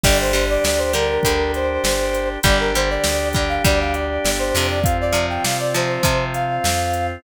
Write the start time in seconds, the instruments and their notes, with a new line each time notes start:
0.04 electric bass (finger) G1, acoustic guitar (steel) D3 G3, drawbar organ D4 G4, brass section D5, kick, crash
0.20 brass section C5
0.33 acoustic guitar (steel) D3 G3, closed hi-hat
0.50 brass section D5
0.64 electric bass (finger) D2, brass section D5, snare
0.78 brass section C5
0.93 acoustic guitar (steel) D3 G3, brass section A#4, closed hi-hat
1.23 electric bass (finger) D2, acoustic guitar (steel) D3 G3, kick, closed hi-hat
1.54 brass section C5, closed hi-hat
1.84 electric bass (finger) G1, snare
2.14 closed hi-hat
2.43 electric bass (finger) G1, acoustic guitar (steel) D3 G3, drawbar organ D4 G4, brass section D5, kick, closed hi-hat
2.60 brass section A#4
2.75 acoustic guitar (steel) D3 G3, brass section C5, closed hi-hat
2.90 brass section D5
3.04 electric bass (finger) D2, snare
3.33 acoustic guitar (steel) D3 G3, brass section D5, kick, closed hi-hat
3.49 brass section F5
3.64 electric bass (finger) D2, acoustic guitar (steel) D3 G3, brass section D5, kick, closed hi-hat
3.81 brass section F5
3.94 brass section D5, closed hi-hat
4.25 electric bass (finger) G1, snare
4.39 brass section C5
4.54 electric bass (finger) F2, acoustic guitar (steel) C3 F3, open hi-hat
4.70 brass section D5
4.83 drawbar organ C4 F4, brass section F5, kick, closed hi-hat
5.01 brass section D5
5.12 acoustic guitar (steel) C3 F3, closed hi-hat
5.30 brass section G5
5.44 electric bass (finger) C3, brass section F5, snare
5.59 brass section D5
5.74 acoustic guitar (steel) C3 F3, brass section C5, closed hi-hat
6.03 acoustic guitar (steel) C3 F3, electric bass (finger) C3, kick, closed hi-hat
6.34 brass section F5, closed hi-hat
6.64 electric bass (finger) F2, snare
6.93 closed hi-hat